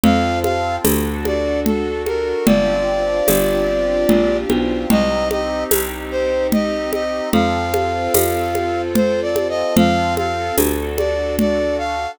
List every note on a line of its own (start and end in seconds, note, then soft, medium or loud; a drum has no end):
0.03 0.78 F2 medium
0.03 0.84 C4 medium
0.03 0.84 F4 medium
0.03 0.84 A4 medium
0.03 0.39 F5 loud
0.03 low conga medium
0.43 0.76 F5 loud
0.43 high conga medium
0.84 2.33 D2 medium
0.84 2.46 D4 medium
0.84 2.46 F#4 medium
0.84 2.46 A4 medium
0.84 tambourine medium
0.84 high conga medium
1.25 1.60 D5 medium
1.25 high conga medium
1.65 2.02 A4 medium
1.65 low conga medium
2.06 2.45 A#4 medium
2.06 high conga medium
2.46 3.21 G1 medium
2.46 4.87 C4 medium
2.46 4.87 D4 medium
2.46 4.87 F4 medium
2.46 4.87 G4 medium
2.46 4.37 D5 loud
2.46 low conga medium
3.28 4.05 G1 medium
3.28 tambourine medium
3.28 high conga medium
4.09 4.45 A#1 medium
4.09 low conga medium
4.50 4.86 B1 medium
4.50 high conga medium
4.89 5.65 C2 medium
4.89 7.30 C4 medium
4.89 7.30 D#4 medium
4.89 7.30 G4 medium
4.89 5.28 D#5 loud
4.89 low conga medium
5.31 5.64 D#5 loud
5.31 high conga medium
5.71 7.21 C2 medium
5.71 tambourine medium
5.71 high conga medium
6.11 6.47 C5 medium
6.52 6.91 D#5 loud
6.52 low conga medium
6.93 7.29 D#5 medium
6.93 high conga medium
7.33 8.08 F2 medium
7.33 9.74 C4 medium
7.33 9.74 F4 medium
7.33 9.74 A4 medium
7.33 8.82 F5 loud
7.33 low conga medium
7.74 high conga medium
8.14 9.64 F2 medium
8.14 tambourine medium
8.14 high conga medium
8.55 high conga medium
8.95 9.21 C5 loud
8.95 low conga medium
9.22 9.47 D5 medium
9.36 high conga medium
9.49 9.75 D#5 loud
9.76 10.51 F2 medium
9.76 10.57 C4 medium
9.76 10.57 F4 medium
9.76 10.57 A4 medium
9.76 10.15 F5 loud
9.76 low conga medium
10.17 10.56 F5 loud
10.17 high conga medium
10.57 12.07 D2 medium
10.57 12.18 D4 medium
10.57 12.18 F#4 medium
10.57 12.18 A4 medium
10.57 tambourine medium
10.57 high conga medium
10.98 11.35 D5 medium
10.98 high conga medium
11.39 11.77 D5 loud
11.39 low conga medium
11.78 12.11 F5 loud